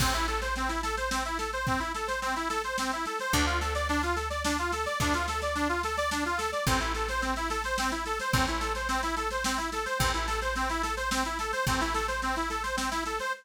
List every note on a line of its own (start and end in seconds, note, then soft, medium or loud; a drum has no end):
0.00 3.07 A1 medium
0.00 0.14 C4 medium
0.00 kick loud
0.00 snare medium
0.00 crash loud
0.14 0.27 E4 medium
0.14 snare medium
0.28 0.40 A4 medium
0.28 snare medium
0.42 0.55 C5 medium
0.42 snare medium
0.56 0.69 C4 medium
0.56 snare medium
0.68 0.81 E4 medium
0.68 snare medium
0.83 0.96 A4 medium
0.83 snare medium
0.97 1.10 C5 medium
0.97 snare medium
1.11 1.23 C4 medium
1.11 snare loud
1.25 1.38 E4 medium
1.25 snare medium
1.38 1.51 A4 medium
1.38 snare medium
1.53 1.66 C5 medium
1.53 snare medium
1.67 1.80 C4 medium
1.67 kick medium
1.67 snare medium
1.80 1.92 E4 medium
1.80 snare medium
1.94 2.07 A4 medium
1.94 snare medium
2.07 2.20 C5 medium
2.07 snare medium
2.22 2.35 C4 medium
2.22 snare medium
2.36 2.49 E4 medium
2.36 snare medium
2.49 2.62 A4 medium
2.49 snare medium
2.64 2.77 C5 medium
2.64 snare medium
2.78 2.91 C4 medium
2.78 snare loud
2.92 3.05 E4 medium
2.92 snare medium
3.06 3.19 A4 medium
3.06 snare medium
3.19 3.33 C5 medium
3.19 snare medium
3.33 4.87 D2 loud
3.33 3.46 D4 medium
3.33 kick medium
3.33 snare medium
3.46 3.59 F4 medium
3.46 snare medium
3.61 3.74 A4 medium
3.61 snare medium
3.75 3.88 D5 medium
3.75 snare medium
3.89 4.02 D4 medium
3.89 snare medium
4.03 4.16 F4 medium
4.03 snare medium
4.16 4.29 A4 soft
4.16 snare medium
4.30 4.43 D5 medium
4.30 snare medium
4.44 4.57 D4 medium
4.44 snare loud
4.58 4.71 F4 medium
4.58 snare medium
4.72 4.85 A4 medium
4.72 snare medium
4.86 4.99 D5 medium
4.86 snare medium
5.00 6.53 D2 medium
5.00 5.14 D4 medium
5.00 kick medium
5.00 snare medium
5.14 5.27 F4 medium
5.14 snare medium
5.28 5.41 A4 medium
5.28 snare medium
5.42 5.55 D5 medium
5.42 snare medium
5.55 5.68 D4 medium
5.55 snare medium
5.69 5.82 F4 medium
5.69 snare medium
5.83 5.97 A4 medium
5.83 snare medium
5.97 6.10 D5 medium
5.97 snare medium
6.11 6.24 D4 medium
6.11 snare loud
6.25 6.38 F4 medium
6.25 snare medium
6.38 6.51 A4 medium
6.38 snare medium
6.52 6.65 D5 medium
6.52 snare medium
6.67 8.20 A1 medium
6.67 6.80 C4 medium
6.67 kick loud
6.67 snare medium
6.80 6.93 E4 medium
6.80 snare medium
6.94 7.08 A4 medium
6.94 snare medium
7.08 7.22 C5 medium
7.08 snare medium
7.22 7.34 C4 medium
7.22 snare medium
7.36 7.49 E4 medium
7.36 snare medium
7.50 7.63 A4 medium
7.50 snare medium
7.64 7.77 C5 medium
7.64 snare medium
7.78 7.91 C4 medium
7.78 snare loud
7.91 8.04 E4 medium
7.91 snare medium
8.05 8.19 A4 medium
8.05 snare medium
8.19 8.33 C5 medium
8.19 snare medium
8.33 9.87 A1 medium
8.33 8.46 C4 medium
8.33 kick loud
8.33 snare medium
8.47 8.60 E4 medium
8.47 snare medium
8.60 8.73 A4 medium
8.60 snare medium
8.75 8.88 C5 medium
8.75 snare medium
8.89 9.01 C4 medium
8.89 snare medium
9.03 9.15 E4 medium
9.03 snare medium
9.16 9.29 A4 medium
9.16 snare medium
9.31 9.44 C5 medium
9.31 snare medium
9.44 9.58 C4 medium
9.44 snare loud
9.57 9.70 E4 medium
9.57 snare medium
9.72 9.85 A4 medium
9.72 snare medium
9.86 9.98 C5 medium
9.86 snare medium
9.99 11.53 A1 loud
9.99 10.12 C4 medium
9.99 kick loud
9.99 snare medium
10.14 10.27 E4 medium
10.14 snare medium
10.27 10.40 A4 medium
10.27 snare medium
10.42 10.54 C5 medium
10.42 snare medium
10.56 10.69 C4 medium
10.56 snare medium
10.69 10.82 E4 medium
10.69 snare medium
10.83 10.95 A4 medium
10.83 snare medium
10.97 11.10 C5 medium
10.97 snare medium
11.11 11.24 C4 medium
11.11 snare loud
11.25 11.38 E4 medium
11.25 snare medium
11.39 11.52 A4 medium
11.39 snare medium
11.52 11.65 C5 medium
11.52 snare medium
11.67 13.20 A1 medium
11.67 11.80 C4 medium
11.67 kick loud
11.67 snare medium
11.81 11.94 E4 medium
11.81 snare medium
11.94 12.07 A4 medium
11.94 snare medium
12.08 12.21 C5 medium
12.08 snare medium
12.22 12.35 C4 medium
12.22 snare medium
12.36 12.49 E4 medium
12.36 snare medium
12.50 12.63 A4 medium
12.50 snare medium
12.63 12.76 C5 medium
12.63 snare medium
12.77 12.90 C4 medium
12.77 snare loud
12.91 13.04 E4 medium
12.91 snare medium
13.06 13.19 A4 medium
13.06 snare medium
13.19 13.33 C5 medium
13.19 snare medium